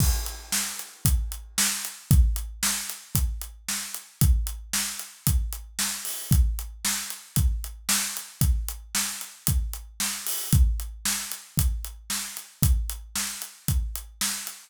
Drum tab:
CC |x-------|--------|--------|--------|
HH |-x-xxx-x|xx-xxx-x|xx-xxx-o|xx-xxx-x|
SD |--o---o-|--o---o-|--o---o-|--o---o-|
BD |o---o---|o---o---|o---o---|o---o---|

CC |--------|--------|--------|
HH |xx-xxx-o|xx-xxx-x|xx-xxx-x|
SD |--o---o-|--o---o-|--o---o-|
BD |o---o---|o---o---|o---o---|